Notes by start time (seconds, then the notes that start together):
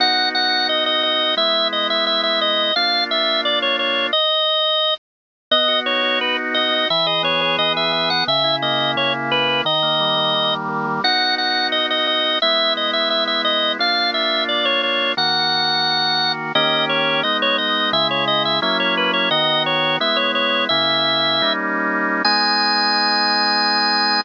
0.00 B3 D#4 F#4 F#5
0.35 F#5
0.69 D#5
0.86 D#5
1.03 D#5
1.37 G#3 B3 E4 E5
1.73 D#5
1.90 E5
2.07 E5
2.23 E5
2.41 D#5
2.76 A#3 D4 F4 F5
3.11 E5
3.45 D5
3.62 C#5
3.79 C#5
4.13 D#5
5.51 B3 D#5
5.68 F#4
5.86 D#4 C#5
6.03 F#4
6.20 B3 B4
6.39 F#4
6.54 F#4 D#5
6.72 D#4
6.90 E3 E5
7.06 G#4 D#5
7.23 B3 C#5
7.41 G#4 C#5
7.58 E3 D#5
7.76 G#4 E5
7.92 G#4 E5
8.10 B3 F#5
8.27 C#3 E5
8.44 E4
8.62 A#3 D#5
8.80 E4
8.96 C#3 C#5
9.14 E4
9.31 E4 B4
9.49 A#3
9.65 D#3 D#5
9.83 A#3
10.00 G3
10.17 A#3
10.34 D#3
10.52 A#3
10.69 A#3
10.86 G3
11.04 B3 D#4 F#4 F#5
11.38 F#5
11.72 D#5
11.90 D#5
12.07 D#5
12.42 G#3 B3 E4 E5
12.77 D#5
12.93 E5
13.10 E5
13.27 E5
13.45 D#5
13.79 A#3 D4 F4 F5
14.14 E5
14.49 D5
14.65 C#5
14.83 C#5
15.17 D#3 A#3 F#4 F#5
16.55 D#3 A#3 C#4 G4 D#5
16.89 C#5
17.23 G#3 B3 D#4 D#5
17.42 C#5
17.58 D#5
17.93 C#3 G#3 E4 E5
18.11 C#5
18.28 D#5
18.45 E5
18.62 F#3 A#3 C#4 E4 E5
18.80 C#5
18.97 B4
19.13 C#5
19.31 D#3 B3 F#4 D#5
19.66 C#5
20.00 G#3 B3 E4 E5
20.16 C#5
20.35 C#5
20.69 C#3 A#3 E4 E5
21.42 G3 A#3 C#4 D#4
22.25 G#3 B3 D#4 G#5